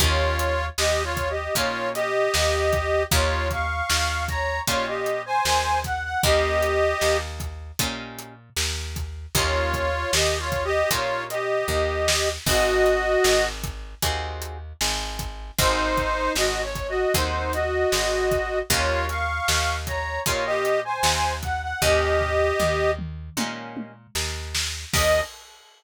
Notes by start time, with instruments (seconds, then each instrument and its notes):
0.00 electric bass (finger) D#2, acoustic guitar (steel) A#3 C#4 D#4 G4, harmonica F4 C#5, kick, closed hi-hat
0.39 closed hi-hat
0.78 electric bass (finger) D#2, harmonica G4 D#5, snare
1.04 harmonica F4 C#5
1.17 kick, closed hi-hat
1.30 harmonica G4 D#5
1.55 electric bass (finger) A#2, acoustic guitar (steel) A#3 C#4 D#4 G4, harmonica F4 C#5, kick, closed hi-hat
1.95 harmonica G4 D#5, closed hi-hat
2.34 electric bass (finger) D#2, snare
2.73 kick, closed hi-hat
3.11 electric bass (finger) D#2, acoustic guitar (steel) A#3 C#4 D#4 G4, harmonica F4 C#5, kick, closed hi-hat
3.51 harmonica F5 C#6, kick, closed hi-hat
3.90 electric bass (finger) D#2, snare
4.28 harmonica C#5 A#5, kick, closed hi-hat
4.67 electric bass (finger) A#2, acoustic guitar (steel) A#3 C#4 D#4 G4, harmonica F4 C#5, kick, closed hi-hat
4.87 harmonica G4 D#5
5.06 closed hi-hat
5.26 harmonica C5 G#5
5.45 electric bass (finger) D#2, snare
5.84 harmonica F#5, kick, closed hi-hat
6.04 harmonica F#5
6.23 electric bass (finger) D#2, acoustic guitar (steel) A#3 C#4 D#4 G4, harmonica G4 D#5, kick, closed hi-hat
6.63 closed hi-hat
7.01 electric bass (finger) D#2, snare
7.40 kick, closed hi-hat
7.79 electric bass (finger) A#2, acoustic guitar (steel) A#3 C#4 D#4 G4, kick, closed hi-hat
8.19 closed hi-hat
8.56 electric bass (finger) D#2, snare
8.96 kick, closed hi-hat
9.35 electric bass (finger) D#2, acoustic guitar (steel) A#3 C#4 D#4 G4, harmonica F4 C#5, kick, closed hi-hat
9.74 kick, closed hi-hat
10.13 electric bass (finger) D#2, harmonica G4 D#5, snare
10.39 harmonica F4 C#5
10.52 kick, closed hi-hat
10.64 harmonica G4 D#5
10.90 electric bass (finger) A#2, acoustic guitar (steel) A#3 C#4 D#4 G4, harmonica F4 C#5, kick, closed hi-hat
11.30 harmonica G4 D#5, closed hi-hat
11.68 electric bass (finger) D#2, kick
12.08 snare
12.46 electric bass (finger) G#1, acoustic guitar (steel) C4 D#4 F#4 G#4, harmonica F#4 D#5, kick, crash
12.86 closed hi-hat
13.24 electric bass (finger) G#1, snare
13.64 kick, closed hi-hat
14.02 electric bass (finger) D#2, acoustic guitar (steel) C4 D#4 F#4 G#4, kick, closed hi-hat
14.42 closed hi-hat
14.81 electric bass (finger) G#1, snare
15.19 kick, closed hi-hat
15.58 electric bass (finger) G#1, acoustic guitar (steel) C4 D#4 F#4 G#4, harmonica D#4 C5, kick, closed hi-hat
15.97 kick, closed hi-hat
16.35 electric bass (finger) G#1, harmonica F#4 D#5, snare
16.63 harmonica C#5
16.75 kick, closed hi-hat
16.89 harmonica F#4 D#5
17.14 electric bass (finger) D#2, acoustic guitar (steel) C4 D#4 F#4 G#4, harmonica D#4 C5, kick, closed hi-hat
17.53 harmonica F#4 D#5, closed hi-hat
17.92 electric bass (finger) G#1, snare
18.31 kick, closed hi-hat
18.70 electric bass (finger) D#2, acoustic guitar (steel) A#3 C#4 D#4 G4, harmonica F4 C#5, kick, closed hi-hat
19.09 harmonica F5 C#6, closed hi-hat
19.48 electric bass (finger) D#2, snare
19.87 harmonica C#5 A#5, kick, closed hi-hat
20.26 electric bass (finger) A#2, acoustic guitar (steel) A#3 C#4 D#4 G4, harmonica F4 C#5, kick, closed hi-hat
20.46 harmonica G4 D#5
20.65 closed hi-hat
20.85 harmonica C5 G#5
21.03 electric bass (finger) D#2, snare
21.43 harmonica F#5, kick, closed hi-hat
21.62 harmonica F#5
21.82 electric bass (finger) D#2, acoustic guitar (steel) A#3 C#4 D#4 G4, harmonica G4 D#5, kick, floor tom
22.21 floor tom
22.60 electric bass (finger) D#2, mid tom
22.99 mid tom
23.37 electric bass (finger) A#2, acoustic guitar (steel) A#3 C#4 D#4 G4, high tom
23.77 high tom
24.15 electric bass (finger) D#2, snare
24.55 snare
24.94 electric bass (finger) D#2, acoustic guitar (steel) A#3 C#4 D#4 G4, harmonica D#5, kick, crash